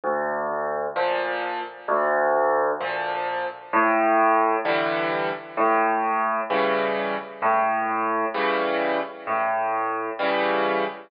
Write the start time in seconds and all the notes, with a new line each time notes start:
0.04 D2
0.96 A#2 F3
1.88 D2
2.80 A#2 F3
3.73 A2
4.65 D3 E3 G3
5.57 A2
6.50 C#3 E3 G3
7.42 A2
8.34 C#3 E3 G3
9.27 A2
10.19 C#3 E3 G3